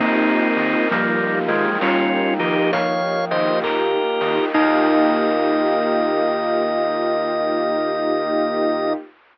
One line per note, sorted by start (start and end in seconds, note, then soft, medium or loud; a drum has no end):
0.00 0.31 D#2 medium
0.00 4.51 A#3 medium
0.00 0.85 A#3 medium
0.00 0.48 A#3 loud
0.00 0.88 C4 medium
0.00 4.51 D#4 medium
0.00 0.88 D#4 loud
0.00 0.48 D#4 loud
0.00 4.51 F4 medium
0.00 4.51 G4 medium
0.00 1.81 A#4 loud
0.00 kick loud
0.00 crash loud
0.05 0.48 F4 loud
0.05 0.48 G4 loud
0.57 0.75 D#3 medium
0.57 0.83 A#3 medium
0.57 0.83 D#4 loud
0.57 2.39 D#5 medium
0.57 open hi-hat loud
0.61 0.83 F4 medium
0.61 0.83 G4 medium
0.91 1.23 D#2 medium
0.91 1.71 F3 medium
0.91 1.39 G3 medium
0.91 1.39 A#3 loud
0.91 1.70 A#3 medium
0.91 1.70 D#4 medium
0.91 2.72 F5 medium
0.91 kick loud
0.91 closed hi-hat loud
0.96 1.70 F4 medium
0.96 1.70 G4 medium
1.48 1.66 D#3 medium
1.48 1.78 F3 medium
1.48 1.78 G#3 loud
1.48 3.30 G5 medium
1.48 open hi-hat loud
1.81 2.15 D#2 medium
1.81 2.37 G3 medium
1.81 2.60 A#3 medium
1.81 2.34 C#4 medium
1.81 2.60 D#4 medium
1.81 2.34 F4 loud
1.81 3.63 A#4 medium
1.81 kick loud
1.81 clap loud
1.86 2.60 F4 medium
1.86 2.60 G4 medium
2.39 2.57 D#3 medium
2.39 3.61 F3 medium
2.39 2.71 D#4 medium
2.39 2.71 G4 medium
2.39 4.21 D#5 medium
2.39 open hi-hat loud
2.72 3.04 D#2 medium
2.72 3.25 C#5 medium
2.72 3.25 F5 loud
2.72 4.48 F5 medium
2.72 kick loud
2.72 closed hi-hat loud
3.30 3.50 D#3 medium
3.30 3.98 A#3 medium
3.30 3.98 D#4 loud
3.30 3.98 F4 medium
3.30 3.59 C5 medium
3.30 3.59 D#5 loud
3.30 4.50 G5 medium
3.30 open hi-hat loud
3.37 3.98 G4 medium
3.63 3.96 D#2 medium
3.63 4.45 G4 medium
3.63 4.51 A#4 medium
3.63 4.45 A#4 medium
3.63 kick loud
3.63 clap loud
4.21 4.39 D#3 medium
4.21 4.47 A#3 medium
4.21 4.47 D#4 loud
4.21 4.47 F4 loud
4.21 4.53 D#5 medium
4.21 open hi-hat loud
4.27 4.47 G4 medium
4.54 8.94 D#2 loud
4.54 8.93 A#3 loud
4.54 8.94 A#3 loud
4.54 8.93 D#4 loud
4.54 8.94 D#4 loud
4.54 8.93 D#4 loud
4.54 8.94 F4 medium
4.54 8.94 G4 loud
4.54 8.93 A#4 loud
4.54 8.93 D#5 loud
4.54 8.93 F5 loud
4.54 8.93 G5 loud
4.54 kick loud
4.54 crash loud
4.58 8.93 F4 loud
4.58 8.93 G4 loud